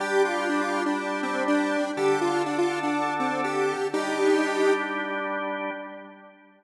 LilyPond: <<
  \new Staff \with { instrumentName = "Lead 1 (square)" } { \time 4/4 \key g \minor \tempo 4 = 122 g'8 f'8 d'16 f'8 d'8. c'8 d'4 | g'8 f'8 d'16 f'8 d'8. c'8 g'4 | <ees' g'>2 r2 | }
  \new Staff \with { instrumentName = "Drawbar Organ" } { \time 4/4 \key g \minor <g d' g'>1 | <d d' a'>1 | <g d' g'>1 | }
>>